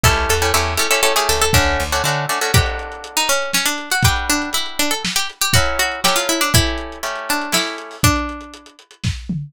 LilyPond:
<<
  \new Staff \with { instrumentName = "Pizzicato Strings" } { \time 3/4 \key d \major \tempo 4 = 120 a'8 a'8 a'8 a'16 a'16 a'16 gis'16 a'16 a'16 | \time 2/4 d'4 r4 | \time 3/4 g'4 r16 dis'16 cis'8 cis'16 d'8 fis'16 | g'8 d'8 e'8 d'16 a'16 r16 g'16 r16 g'16 |
\time 2/4 fis'8 fis'8 g'16 f'16 e'16 d'16 | \time 3/4 e'4. d'8 e'8 r8 | d'4. r4. | }
  \new Staff \with { instrumentName = "Acoustic Guitar (steel)" } { \time 3/4 \key d \major <a cis' e' g'>8. <a cis' e' g'>16 <a cis' e' g'>8 <a cis' e' g'>16 <a cis' e' g'>16 <a cis' e' g'>16 <a cis' e' g'>8. | \time 2/4 <a cis' d' fis'>8. <a cis' d' fis'>16 <a cis' d' fis'>8 <a cis' d' fis'>16 <a cis' d' fis'>16 | \time 3/4 <d' fis' a'>2. | <g d' fis' b'>2. |
\time 2/4 <fis cis' e' a'>4 <fis cis' e' a'>4 | \time 3/4 <a cis' e' g'>4 <a cis' e' g'>4 <a cis' e' g'>4 | r2. | }
  \new Staff \with { instrumentName = "Electric Bass (finger)" } { \clef bass \time 3/4 \key d \major cis,8 e,8 e,4. cis,8 | \time 2/4 d,8 d,8 d4 | \time 3/4 r2. | r2. |
\time 2/4 r2 | \time 3/4 r2. | r2. | }
  \new DrumStaff \with { instrumentName = "Drums" } \drummode { \time 3/4 bd4 r4 r4 | \time 2/4 bd4 r4 | \time 3/4 <cymc bd>16 hh16 hh16 hh16 hh16 hh16 hh16 hh16 sn16 hh16 hh16 hh16 | <hh bd>16 hh16 hh16 hh16 hh16 hh16 hh16 hh16 sn16 hh16 hh16 hh16 |
\time 2/4 <hh bd>16 hh16 hh16 hh16 sn16 hh16 hh16 hh16 | \time 3/4 <hh bd>16 hh16 hh16 hh16 hh16 hh16 hh16 hh16 sn16 hh16 hh16 hho16 | <hh bd>16 hh16 hh16 hh16 hh16 hh16 hh16 hh16 <bd sn>8 toml8 | }
>>